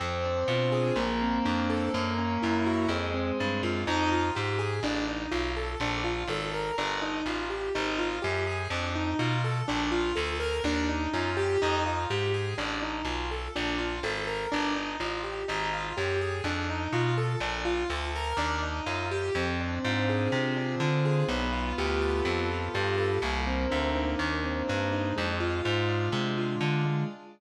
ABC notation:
X:1
M:4/4
L:1/8
Q:1/4=124
K:Fdor
V:1 name="Acoustic Grand Piano"
C D F A B, C D =A | B, _D _F _G A, C =D =F | E F G A D E F =A | D F =A B D E F G |
E F G A D E F =A | D F =A B D E F G | E F G A D E F =A | D F =A B D E F G |
E F G A D E F =A | D F =A B D E F G | C D F A C D F A | =B, F G =A B, F G A |
B, C D E B, C D E | A, F A, D A, F D A, |]
V:2 name="Electric Bass (finger)" clef=bass
F,,2 =B,,2 _B,,,2 F,,2 | _G,,2 G,,2 F,,2 =G,, _G,, | F,,2 A,,2 =A,,,2 =B,,,2 | B,,,2 A,,,2 G,,,2 =A,,,2 |
A,,,2 _G,,2 F,,2 =B,,2 | B,,,2 D,,2 E,,2 _G,,2 | F,,2 A,,2 =A,,,2 =B,,,2 | B,,,2 A,,,2 G,,,2 =A,,,2 |
A,,,2 _G,,2 F,,2 =B,,2 | B,,,2 D,,2 E,,2 _G,,2 | F,,2 A,,2 C,2 D,2 | =B,,,2 D,,2 F,,2 G,,2 |
C,,2 D,,2 E,,2 G,,2 | F,,2 A,,2 C,2 D,2 |]